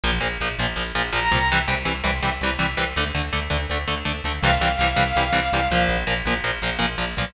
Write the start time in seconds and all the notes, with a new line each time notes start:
0.04 A#1 A#2 F3
0.21 A#1 A#2 F3
0.40 A#1 A#2 F3
0.58 A#1 A#2 F3
0.76 A#1 A#2 F3
0.95 A#1 A#2 F3
1.13 A#1 A#2 F3 A#5
1.31 C2 A#2 F3
1.52 C3 E3 G3
1.68 C2 C3 E3 G3
1.85 C2 C3 E3 G3
2.04 C2 C3 E3 G3
2.22 C2 C3 E3 G3
2.41 C2 C3 E3 G3
2.59 C2 C3 E3 G3
2.77 C2 C3 E3 G3
2.96 D2 D3 A3
3.14 D2 D3 A3
3.33 D2 D3 A3
3.50 D2 D3 A3
3.69 D2 D3 A3
3.88 D2 D3 A3
4.05 D2 D3 A3
4.24 D2 D3 A3
4.41 C2 C3 E3 G3 F5
4.61 C2 C3 E3 G3
4.79 C2 C3 E3 G3
4.96 C2 C3 E3 G3
5.16 C2 C3 E3 G3
5.33 C2 C3 E3 G3
5.52 C2 C3 E3 G3
5.71 C2 A#2 F3
5.89 A#1
6.07 A#1 A#2 F3
6.25 A#1 A#2 F3
6.44 A#1 A#2 F3
6.62 A#1 A#2 F3
6.79 A#1 A#2 F3
6.98 A#1 A#2 F3
7.17 B1 A#2 F3